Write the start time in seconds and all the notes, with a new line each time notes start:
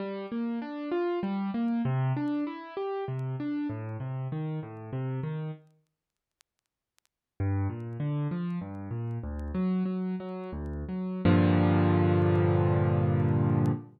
0.00 G3
0.32 A#3
0.62 D4
0.92 F4
1.23 G3
1.54 A#3
1.85 C3
2.17 D4
2.47 E4
2.77 G4
3.08 C3
3.40 D4
3.69 A2
4.00 C3
4.32 D#3
4.63 A2
4.93 C3
5.23 D#3
7.40 G2
7.70 A#2
8.00 D3
8.31 F3
8.61 G2
8.91 A#2
9.23 D2
9.54 F#3
9.85 F#3
10.20 F#3
10.52 D2
10.89 F#3
11.25 G2 A#2 D3 F3